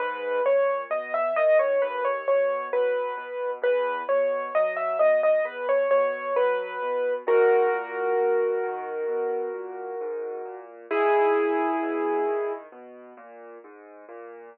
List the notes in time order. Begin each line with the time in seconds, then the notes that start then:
0.00 G#2 B4
0.45 A#2 C#5
0.90 B2 D#5
1.14 E5
1.36 D#3 D#5
1.59 C#5
1.82 D#2 B4
2.05 C#5
2.28 B2 C#5
2.73 F#3 B4
3.17 B2
3.62 E2 B4
4.09 B2 C#5
4.55 F#3 D#5
4.77 E5
4.99 B2 D#5
5.23 D#5
5.45 E2 B4
5.69 C#5
5.91 B2 C#5
6.36 F#3 B4
6.82 B2
7.27 G#2 F#4 A#4
7.73 A#2
8.18 B2
8.63 D#3
9.08 B2
9.54 A#2
10.01 G#2
10.45 A#2
10.91 G#2 E4 G#4
11.36 A#2
11.83 B2
12.26 D#3
12.72 B2
13.17 A#2
13.64 G#2
14.09 A#2